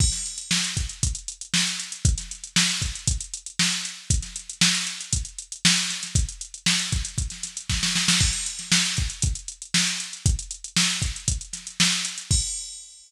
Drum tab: CC |x---------------|----------------|----------------|----------------|
HH |-xxx-xxxxxxx-xxx|xxxx-xxxxxxx-xx-|xxxx-xxxxxxx-xxx|xxxx-xxxxxxx----|
SD |-o--o-------o---|-o--oo------o---|-o--o-------o-oo|----o-o--oo-oooo|
BD |o-----o-o-------|o-----o-o-------|o-------o-------|o-----o-o---o---|

CC |x---------------|----------------|x---------------|
HH |-xxx-xxxxxxx-xxx|xxxx-xxxxxxx-xxx|----------------|
SD |---ooo------o---|----o-----o-o---|----------------|
BD |o-----o-o-------|o-----o-o-------|o---------------|